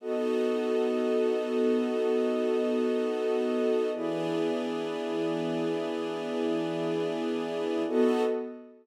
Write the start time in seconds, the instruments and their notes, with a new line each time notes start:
0.00 string ensemble 1 B3 D#4 F#4 A4, pad 2 (warm) B3 F#4 A4 D#5
3.93 string ensemble 1 E3 B3 D4 G#4, pad 2 (warm) E4 G#4 B4 D5
7.87 string ensemble 1 B3 D#4 F#4 A4, pad 2 (warm) B3 F#4 A4 D#5